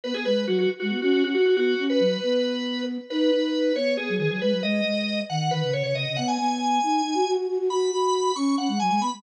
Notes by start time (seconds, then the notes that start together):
0.04 B3 B4
0.14 B3 G#4
0.25 G#3 B4
0.47 F#3 F#4
0.58 F#4
0.80 G#3 F#4
0.91 B3
1.02 C#4 F#4
1.13 C#4 F#4
1.23 C#4 F#4
1.34 F#4
1.45 F#4
1.56 B3 F#4
1.78 C#4
1.90 B4
2.00 F#3
2.23 B3
3.10 D#4 B4
3.31 D#4
3.76 B3 C#5
3.97 B3 G#4
4.09 F#3
4.18 D#3 G#4
4.30 F#3 G#4
4.42 G#3 B4
4.52 F#3
4.63 G#3 D#5
4.84 G#3
5.30 D#3 F#5
5.51 D#3 B4
5.62 C#3
5.73 C#3 C#5
5.83 C#3 C#5
5.95 C#3 D#5
6.06 C#3
6.16 B3 F#5
6.28 G#5
6.39 B3
6.83 D#4
7.05 D#4
7.14 F#4
7.27 F#4
7.37 F#4
7.48 F#4
7.58 F#4
7.70 F#4 B5
7.91 F#4
8.36 C#4 C#6
8.58 C#4 F#5
8.68 G#3
8.80 F#3 G#5
8.89 G#3 G#5
9.00 B3 B5
9.13 G#3